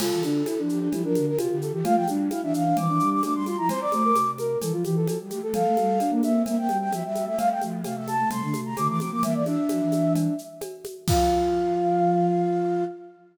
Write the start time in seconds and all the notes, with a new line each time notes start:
0.00 C3 F4 A4, crash, cowbell, low conga, shaker
0.12 E3
0.22 D3 D4, high conga, shaker
0.46 E4, cowbell, high conga, shaker
0.58 F3 D4
0.69 F3 G4, shaker
0.81 D4
0.92 F3 E4 G4, cowbell, low conga, shaker
1.03 F3 D4 A#4
1.15 D3, high conga, shaker
1.27 A#4
1.38 C3 F4 G4, cowbell, high conga, shaker
1.50 D3 G4
1.62 A4, shaker
1.72 E3 G4
1.84 A3 F4 F5, cowbell, low conga, shaker
1.95 F3 G5
2.08 G3 D4, high conga, shaker
2.30 E4 F5, cowbell, high conga, shaker
2.42 E3 D4 E5
2.52 E3 F5, shaker
2.65 D4
2.77 E3 C4 D6, cowbell, low conga, shaker
2.88 E3 D4
3.00 G3, shaker
3.11 D6
3.23 A3 D4 D6, cowbell, high conga, shaker
3.34 G3 C6
3.46 F4 C6, high conga, shaker
3.57 F3 E4 A#5
3.69 C4 C5 C6, cowbell, low conga, shaker
3.81 D5 D6
3.92 A3 C5, high conga, shaker
4.04 A#4
4.15 C3, cowbell, high conga, shaker
4.38 A#4, high conga, shaker
4.61 E3 A4, cowbell, low conga, shaker
4.72 F3 F4
4.85 E3 G4, high conga, shaker
4.96 A4
5.06 F3 A4, cowbell, high conga, shaker
5.20 G3
5.30 A3 G4, high conga, shaker
5.42 A3 A4
5.52 F3 A4 F5, cowbell, low conga, shaker
5.64 A3
5.77 G3, high conga, shaker
5.99 D4, cowbell, high conga, shaker
6.10 A#3
6.23 A#3 E5, high conga, shaker
6.34 C4
6.46 A#3 E5, cowbell, low conga, shaker
6.57 A#3 G5
6.68 G3, high conga, shaker
6.81 G5
6.91 F3 E5, cowbell, high conga, shaker
7.04 G3 E5
7.15 high conga, shaker
7.26 A3 E5
7.37 A3 F5, cowbell, low conga, shaker
7.50 G5
7.61 F3 A3, high conga, shaker
7.84 C3 A3 F5, cowbell, high conga, shaker
7.96 A3 E5
8.08 A5, high conga, shaker
8.19 A3
8.30 C3 A3 C6, cowbell, low conga, shaker
8.42 D3 A3
8.54 C3, high conga, shaker
8.65 A#5
8.77 D3 A3 D6, cowbell, high conga, shaker
8.88 E3 D6
9.00 F3 C4 D6, high conga, shaker
9.11 F3 A#3 D6
9.23 E3 A#3 E5, cowbell, low conga, shaker
9.35 E3 D5
9.46 D4 E5, high conga, shaker
9.69 F3, cowbell, high conga, shaker
9.80 E3
9.92 high conga, shaker
10.15 cowbell, low conga, shaker
10.38 shaker
10.61 cowbell, high conga, shaker
10.85 high conga, shaker
11.08 F3 F4 F5, kick, crash